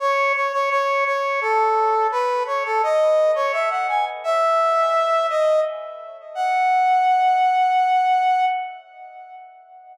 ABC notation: X:1
M:3/4
L:1/16
Q:1/4=85
K:F#dor
V:1 name="Brass Section"
c2 c c c2 c2 A4 | B2 c A d3 c e f g z | e6 d2 z4 | f12 |]